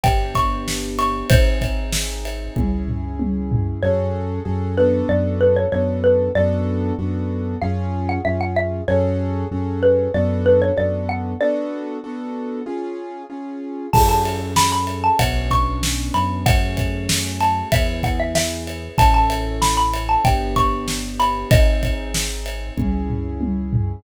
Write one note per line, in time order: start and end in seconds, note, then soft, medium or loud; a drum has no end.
0.03 1.20 G1 medium
0.03 1.27 B3 medium
0.03 1.27 D4 medium
0.03 1.27 G4 medium
0.03 0.34 G5 medium
0.03 kick loud
0.03 ride loud
0.35 0.88 C#6 medium
0.35 kick medium
0.35 ride medium
0.68 snare medium
0.99 1.28 C#6 medium
0.99 ride medium
1.30 2.46 G#1 medium
1.30 2.54 C4 medium
1.30 2.54 D#4 medium
1.30 2.54 G#4 medium
1.30 3.27 C5 medium
1.30 kick loud
1.30 ride loud
1.61 kick medium
1.61 ride medium
1.92 snare loud
2.25 ride medium
2.56 3.73 C#2 medium
2.56 3.80 C#4 medium
2.56 3.80 E4 medium
2.56 3.80 G#4 medium
2.56 kick medium
2.56 high tom medium
2.88 floor tom medium
3.19 high tom medium
3.52 floor tom loud
3.83 4.39 F#2 medium
3.83 4.40 C#4 loud
3.83 4.40 F#4 loud
3.83 4.40 G#4 loud
3.83 4.40 A4 loud
3.83 4.61 C#5 medium
4.45 5.02 F#2 loud
4.45 4.75 C#4 medium
4.45 4.75 F#4 medium
4.45 4.75 G#4 medium
4.45 4.75 A4 medium
4.77 5.66 B3 loud
4.77 5.66 D4 loud
4.77 5.66 F#4 loud
4.77 5.66 A4 loud
4.77 5.07 B4 medium
5.09 5.66 F#2 loud
5.09 5.35 D5 medium
5.41 5.56 B4 medium
5.56 5.71 C#5 medium
5.72 6.29 F#2 medium
5.72 6.29 B3 medium
5.72 6.29 D4 medium
5.72 6.29 F#4 medium
5.72 6.29 A4 medium
5.72 5.98 C#5 medium
6.04 6.32 B4 medium
6.35 6.92 F#2 loud
6.35 6.93 B3 loud
6.35 6.93 D4 loud
6.35 6.93 F#4 loud
6.35 6.93 A4 loud
6.35 7.38 D5 medium
6.98 7.55 F#2 medium
6.98 7.55 B3 medium
6.98 7.55 D4 medium
6.98 7.55 F#4 loud
6.98 7.55 A4 medium
7.61 8.19 F#2 loud
7.61 8.19 C#4 loud
7.61 8.19 F4 loud
7.61 8.19 G#4 loud
7.61 8.01 F5 medium
8.09 8.24 F#5 medium
8.25 8.82 F#2 medium
8.25 8.81 C#4 medium
8.25 8.81 F4 medium
8.25 8.81 G#4 medium
8.25 8.40 E5 medium
8.41 8.56 F#5 medium
8.56 8.84 E5 medium
8.88 9.45 F#2 loud
8.88 9.45 C#4 loud
8.88 9.45 F#4 loud
8.88 9.45 G#4 loud
8.88 9.45 A4 loud
8.88 9.80 C#5 medium
9.51 10.08 F#2 medium
9.51 10.08 C#4 medium
9.51 10.08 F#4 medium
9.51 10.08 G#4 medium
9.51 10.08 A4 medium
9.83 10.12 B4 medium
10.14 10.71 F#2 loud
10.14 10.71 B3 loud
10.14 10.71 D4 loud
10.14 10.71 F#4 loud
10.14 10.71 A4 loud
10.14 10.42 D5 medium
10.46 10.61 B4 medium
10.62 10.77 C#5 medium
10.76 11.34 F#2 medium
10.76 11.33 B3 medium
10.76 11.33 D4 medium
10.76 11.33 F#4 medium
10.76 11.33 A4 medium
10.76 11.05 D5 medium
11.09 11.38 F#5 medium
11.41 11.97 B3 loud
11.41 11.97 D4 loud
11.41 11.97 F#4 loud
11.41 11.97 A4 loud
11.41 13.24 D5 medium
12.04 12.61 B3 medium
12.04 12.61 D4 medium
12.04 12.61 F#4 loud
12.04 12.61 A4 loud
12.66 13.23 C#4 medium
12.66 13.23 F4 loud
12.66 13.23 G#4 loud
13.30 13.86 C#4 medium
13.30 13.86 F4 medium
13.30 13.86 G#4 medium
13.93 15.09 F#2 medium
13.93 15.18 C#4 medium
13.93 15.18 F#4 medium
13.93 15.18 G#4 medium
13.93 15.18 A4 medium
13.93 14.08 A5 medium
13.93 kick loud
13.93 crash loud
14.09 14.50 A5 medium
14.25 ride medium
14.56 14.71 B5 medium
14.56 snare loud
14.72 15.00 B5 medium
14.87 ride medium
15.04 15.19 A5 medium
15.19 16.09 B1 medium
15.19 16.43 B3 medium
15.19 16.43 C#4 medium
15.19 16.43 D4 medium
15.19 16.43 F#4 medium
15.19 15.49 F#5 medium
15.19 kick medium
15.19 ride loud
15.51 16.12 C#6 medium
15.51 kick medium
15.51 ride medium
15.83 snare loud
16.14 17.62 F#2 medium
16.14 16.41 B5 medium
16.14 ride medium
16.46 17.70 A3 medium
16.46 17.70 C#4 medium
16.46 17.70 F#4 medium
16.46 17.70 G#4 medium
16.46 17.29 F#5 medium
16.46 kick loud
16.46 ride loud
16.77 kick medium
16.77 ride medium
17.09 snare loud
17.40 17.68 A5 medium
17.40 ride medium
17.72 18.89 E2 medium
17.72 18.96 B3 medium
17.72 18.96 E4 medium
17.72 18.96 G#4 medium
17.72 18.02 E5 medium
17.72 kick loud
17.72 ride loud
18.03 18.19 F#5 medium
18.03 kick medium
18.03 ride medium
18.20 18.35 E5 medium
18.35 18.64 E5 medium
18.35 snare loud
18.67 ride medium
18.98 20.14 A1 medium
18.98 20.22 C#4 medium
18.98 20.22 E4 medium
18.98 20.22 A4 medium
18.98 19.13 A5 medium
18.98 kick loud
18.98 ride loud
19.14 19.56 A5 medium
19.30 ride medium
19.62 19.77 B5 medium
19.62 snare loud
19.77 20.03 B5 medium
19.94 ride medium
20.09 20.24 A5 medium
20.25 21.41 G1 medium
20.25 21.49 B3 medium
20.25 21.49 D4 medium
20.25 21.49 G4 medium
20.25 20.54 G5 medium
20.25 kick loud
20.25 ride loud
20.56 21.12 C#6 medium
20.56 kick medium
20.56 ride medium
20.88 snare medium
21.19 21.47 B5 medium
21.19 ride medium
21.50 22.67 G#1 medium
21.50 22.74 C4 medium
21.50 22.74 D#4 medium
21.50 22.74 G#4 medium
21.50 23.13 D#5 medium
21.50 kick loud
21.50 ride loud
21.83 kick medium
21.83 ride medium
22.14 snare loud
22.46 ride medium
22.77 23.94 C#2 medium
22.77 24.01 C#4 medium
22.77 24.01 E4 medium
22.77 24.01 G#4 medium
22.77 kick medium
22.77 high tom medium
23.10 floor tom medium
23.41 high tom medium
23.73 floor tom loud